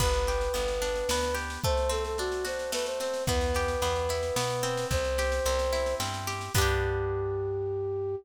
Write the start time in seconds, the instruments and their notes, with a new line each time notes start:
0.00 electric bass (finger) G1, orchestral harp B3, flute B4, kick, snare
0.14 snare
0.27 orchestral harp G4, snare
0.41 snare
0.54 electric bass (finger) G1, orchestral harp B3, snare
0.68 snare
0.82 orchestral harp D4, snare
0.95 snare
1.09 electric bass (finger) D2, orchestral harp B3, snare
1.23 snare
1.35 orchestral harp G4, snare
1.50 snare
1.64 orchestral harp A3, flute C5, kick, snare
1.77 snare
1.89 orchestral harp C4, flute A4, snare
2.05 flute A4, snare
2.18 orchestral harp D4, flute F#4, snare
2.32 snare
2.45 orchestral harp F#4, flute C5, snare
2.59 snare
2.72 orchestral harp A3, flute B4, snare
2.86 flute C5, snare
3.00 orchestral harp C4, flute C5, snare
3.14 snare
3.27 electric bass (finger) E2, orchestral harp B3, flute B4, kick, snare
3.41 snare
3.55 orchestral harp G4, snare
3.68 snare
3.82 electric bass (finger) E2, orchestral harp B3, snare
3.95 snare
4.09 orchestral harp E4, snare
4.23 snare
4.36 electric bass (finger) B2, orchestral harp B3, snare
4.50 snare
4.63 orchestral harp C4, snare
4.77 snare
4.91 electric bass (finger) C2, flute C5, kick, snare
5.05 snare
5.18 orchestral harp G4, snare
5.32 snare
5.45 electric bass (finger) C2, orchestral harp C4, snare
5.59 snare
5.73 orchestral harp E4, snare
5.86 snare
6.00 electric bass (finger) G2, orchestral harp C4, snare
6.14 snare
6.27 orchestral harp G4, snare
6.41 snare
6.54 electric bass (finger) G2, orchestral harp B3 D4, flute G4, kick, crash
6.62 orchestral harp G4